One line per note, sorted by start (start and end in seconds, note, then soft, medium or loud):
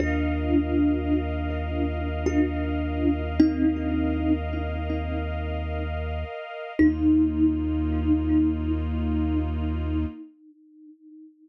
0.00 6.25 D#2 loud
0.00 1.99 D4 medium
0.00 1.99 F4 medium
0.00 6.73 A#4 medium
0.00 6.73 D#5 medium
0.00 6.73 F5 medium
2.26 3.21 D4 medium
2.26 3.21 F4 medium
3.40 4.32 C4 medium
3.40 4.32 D#4 medium
6.79 10.06 D#2 loud
6.79 10.04 A#3 medium
6.79 10.04 D#4 loud
6.79 10.05 D#4 loud
6.79 10.04 F4 loud